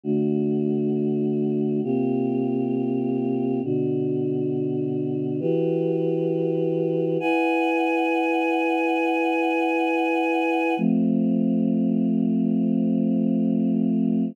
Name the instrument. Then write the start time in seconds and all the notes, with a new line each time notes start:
choir aahs
0.04 D3 A3 F#4
1.83 C3 A#3 F4 G4
3.64 B2 D3 F#4
5.40 E3 F#4 G4 B4
7.20 E4 B4 F#5 G#5
10.77 F3 A3 C4